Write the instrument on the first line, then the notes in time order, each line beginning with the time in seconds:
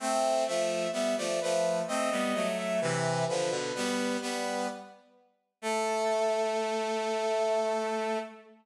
brass section
0.00 A3 C4
0.47 F3 A3 E5
0.93 G3 B3 E5
1.17 F3 A3 D5
1.41 F3 A3 B4
1.88 A3 C4 D#5
2.11 G3 B3
2.34 F#3 A3
2.58 E5
2.81 C3 E3 B4
3.28 D3 F3 B4
3.50 B2 D3
3.75 G3 B3
4.21 G3 B3 B4
5.62 A3 A4